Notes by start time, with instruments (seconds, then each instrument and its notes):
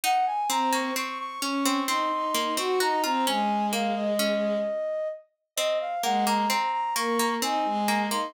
0.04 harpsichord D#4, flute F#5
0.27 flute G#5
0.50 harpsichord C4, violin C4, flute A#5
0.73 harpsichord A#3, flute C#6
0.96 harpsichord C4, flute C#6
1.19 flute C#6
1.42 harpsichord C#4, violin C#4, flute C#6
1.65 harpsichord C4
1.87 harpsichord C4, violin D#4, flute C6
2.11 violin D#4
2.34 harpsichord A#3
2.57 harpsichord C4, violin F#4, flute C#6
2.80 violin D#4, harpsichord F#4, flute A#5
3.03 violin C4, harpsichord F4, flute A#5
3.27 violin G#3, harpsichord C#4, flute G#5
3.73 harpsichord A#3, flute F5
3.96 flute D#5
4.19 harpsichord C#4
5.56 harpsichord C4, flute D#5
5.81 flute F5
6.03 violin G#3, harpsichord A#3, flute F#5
6.26 harpsichord A#3, flute A#5
6.50 harpsichord C4, flute A#5
6.72 flute A#5
6.95 harpsichord A#3, violin A#3, flute C#6
7.19 harpsichord A#3
7.42 harpsichord C4, violin D#4, flute G#5
7.65 violin G#3
7.88 harpsichord A#3
8.11 harpsichord A#3, violin D#4, flute C6